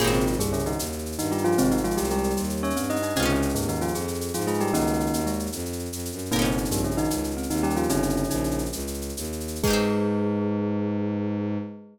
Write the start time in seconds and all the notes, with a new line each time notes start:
0.00 G#1 A#2 A#3 F4 G4 G#4, crash
0.04 C4 D#4, shaker
0.13 C3 C4, shaker
0.20 shaker
0.26 F4, shaker
0.33 shaker
0.39 C2 G2 G3 G#4, shaker
0.46 shaker
0.53 C#3 C#4, shaker
0.59 shaker
0.66 D#3 D#4, shaker
0.72 shaker
0.79 D#2, shaker
0.86 shaker
0.92 shaker
0.99 shaker
1.06 shaker
1.12 shaker
1.18 G2 D#3 D#4, shaker
1.25 shaker
1.31 G3 F4 G4, shaker
1.38 shaker
1.44 F3 F4, shaker
1.52 shaker
1.58 G#1 C3 G#3 C4, shaker
1.64 shaker
1.71 D#3 D#4, shaker
1.77 shaker
1.84 F3 G#3 F4, shaker
1.91 shaker
1.97 C2 G3 G4, shaker
2.04 shaker
2.10 G3 G#3 G4, shaker
2.18 shaker
2.23 shaker
2.30 shaker
2.37 D#2 G3, shaker
2.44 shaker
2.50 shaker
2.57 shaker
2.63 C#4 C#5, shaker
2.70 shaker
2.76 G2 C4, shaker
2.83 shaker
2.90 D#4 D#5, shaker
2.96 shaker
3.02 D#4, shaker
3.09 shaker
3.16 C#2 C3 C4 C#4 G#4, shaker
3.20 D#4 F4, shaker
3.25 C#3 C#4, shaker
3.35 shaker
3.42 shaker
3.49 shaker
3.55 D#2 G#2 G#3, shaker
3.62 shaker
3.68 D#3 D#4, shaker
3.75 shaker
3.81 F3 F4, shaker
3.88 shaker
3.95 F2 G#4, shaker
4.01 shaker
4.08 shaker
4.14 shaker
4.21 shaker
4.28 shaker
4.34 G#2 F3 F4, shaker
4.41 shaker
4.47 G#3 F4 G#4, shaker
4.54 shaker
4.60 G3 G4, shaker
4.67 shaker
4.73 C#2 D#3 A#3 C#4 D#4, shaker
4.81 shaker
4.87 shaker
4.93 shaker
5.00 shaker
5.06 shaker
5.13 D#2, shaker
5.20 shaker
5.26 G#3, shaker
5.33 shaker
5.39 shaker
5.46 shaker
5.52 F2, shaker
5.59 shaker
5.65 shaker
5.73 shaker
5.79 shaker
5.85 shaker
5.92 F2, shaker
5.99 shaker
6.05 shaker
6.12 F#2, shaker
6.18 shaker
6.25 shaker
6.31 G1 A#2 A#3 C4 D#4 A#4, shaker
6.36 D#4 G4, shaker
6.42 C3 C4 C#4, shaker
6.51 shaker
6.58 shaker
6.65 shaker
6.71 A#1 G2 G3, shaker
6.77 shaker
6.84 C#3 C#4, shaker
6.91 shaker
6.97 D#3 D#4, shaker
7.04 shaker
7.10 C#2, shaker
7.17 shaker
7.24 shaker
7.31 shaker
7.37 C4, shaker
7.43 shaker
7.50 D#2 D#3 D#4, shaker
7.57 shaker
7.63 G3 C#4 G4, shaker
7.70 shaker
7.76 F3 F4, shaker
7.83 shaker
7.89 G1 C#3 C4 C#4 D#4, shaker
7.96 shaker
8.03 shaker
8.09 shaker
8.17 shaker
8.24 shaker
8.30 A#1 D#4, shaker
8.36 shaker
8.44 shaker
8.51 shaker
8.58 shaker
8.65 shaker
8.72 C#2, shaker
8.79 shaker
8.87 shaker
8.94 shaker
9.01 shaker
9.09 shaker
9.17 D#2, shaker
9.24 shaker
9.32 shaker
9.40 shaker
9.48 shaker
9.55 shaker
9.63 G#2 G#3 G#4, kick, crash
9.67 D#4 G4
9.73 C4